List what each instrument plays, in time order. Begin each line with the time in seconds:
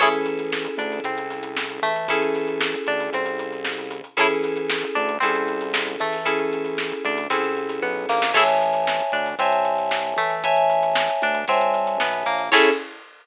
0.00 synth bass 1 A1, electric piano 2 C#4 E4 G#4 A4, pizzicato strings E4 G#4 A4 C#5, kick, closed hi-hat
0.12 closed hi-hat
0.26 closed hi-hat
0.39 closed hi-hat
0.52 snare
0.65 closed hi-hat
0.77 synth bass 1 D2, pizzicato strings D4, closed hi-hat
0.92 closed hi-hat
1.04 synth bass 1 C2, pizzicato strings C4, kick, closed hi-hat
1.18 closed hi-hat
1.30 snare, closed hi-hat
1.43 closed hi-hat
1.57 snare
1.70 closed hi-hat
1.82 synth bass 1 A1, pizzicato strings A3, closed hi-hat
1.96 closed hi-hat
2.08 electric piano 2 C#4 E4 G#4 A4, kick, closed hi-hat
2.22 snare, closed hi-hat
2.35 snare, closed hi-hat
2.48 closed hi-hat
2.61 snare
2.74 snare, closed hi-hat
2.87 synth bass 1 D2, pizzicato strings D4, closed hi-hat
3.00 closed hi-hat
3.12 synth bass 1 C2, pizzicato strings C4, kick, closed hi-hat
3.26 closed hi-hat
3.39 closed hi-hat
3.52 closed hi-hat
3.64 snare
3.78 closed hi-hat
3.91 closed hi-hat
4.04 closed hi-hat
4.17 synth bass 1 A1, electric piano 2 C#4 E4 G#4 A4, pizzicato strings G#4 A4 C#5, kick, closed hi-hat
4.21 pizzicato strings E4
4.30 closed hi-hat
4.43 snare, closed hi-hat
4.57 closed hi-hat
4.70 snare
4.83 closed hi-hat
4.95 synth bass 1 D2, pizzicato strings D4, closed hi-hat
5.09 closed hi-hat
5.20 synth bass 1 C2, pizzicato strings C4, electric piano 2 C#4 E4 G#4 A4, kick, closed hi-hat
5.35 closed hi-hat
5.48 closed hi-hat
5.61 closed hi-hat
5.74 snare
5.87 closed hi-hat
6.00 synth bass 1 A1, pizzicato strings A3, closed hi-hat
6.12 snare, open hi-hat
6.25 electric piano 2 C#4 E4 G#4 A4, kick, closed hi-hat
6.39 closed hi-hat
6.53 closed hi-hat
6.65 closed hi-hat
6.78 snare
6.92 closed hi-hat
7.05 synth bass 1 D2, pizzicato strings D4, closed hi-hat
7.18 closed hi-hat
7.30 synth bass 1 C2, pizzicato strings C4, electric piano 2 C#4 E4 G#4 A4, kick, closed hi-hat
7.43 snare, closed hi-hat
7.57 closed hi-hat
7.69 snare, closed hi-hat
7.82 synth bass 1 B1, pizzicato strings B3, kick
8.09 synth bass 1 A#1, pizzicato strings A#3, snare
8.22 snare
8.34 synth bass 1 A1, pizzicato strings E4 G#4 A4 C#5, electric piano 2 C#5 E5 G#5 A5, kick, crash
8.48 closed hi-hat
8.61 closed hi-hat
8.73 closed hi-hat
8.87 snare
8.99 snare, closed hi-hat
9.12 synth bass 1 D2, pizzicato strings D4, closed hi-hat
9.26 snare, closed hi-hat
9.39 synth bass 1 C2, pizzicato strings C4, electric piano 2 C#5 E5 G#5 A5, kick, closed hi-hat
9.52 closed hi-hat
9.65 closed hi-hat
9.78 closed hi-hat
9.91 snare
10.04 closed hi-hat
10.16 synth bass 1 A1, pizzicato strings A3, closed hi-hat
10.30 closed hi-hat
10.44 electric piano 2 C#5 E5 G#5 A5, kick, closed hi-hat
10.56 closed hi-hat
10.70 closed hi-hat
10.83 closed hi-hat
10.95 snare
11.09 closed hi-hat
11.22 synth bass 1 D2, pizzicato strings D4, closed hi-hat
11.34 closed hi-hat
11.48 synth bass 1 C2, pizzicato strings C4, electric piano 2 C#5 E5 G#5 A5, kick, closed hi-hat
11.61 closed hi-hat
11.74 closed hi-hat
11.87 closed hi-hat
12.00 synth bass 1 B1, pizzicato strings B3, snare
12.13 closed hi-hat
12.26 synth bass 1 A#1, pizzicato strings A#3, closed hi-hat
12.39 closed hi-hat
12.52 synth bass 1 A2, electric piano 2 C#4 E4 G#4 A4, pizzicato strings E4 G#4 A4 C#5, kick, crash